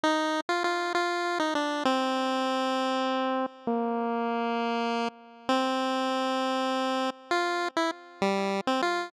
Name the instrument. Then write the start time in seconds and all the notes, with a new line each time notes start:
lead 1 (square)
0.04 D#4
0.49 F4
0.64 F4
0.95 F4
1.40 D#4
1.55 D4
1.85 C4
3.67 A#3
5.49 C4
7.31 F4
7.77 E4
8.22 G3
8.67 C4
8.82 F4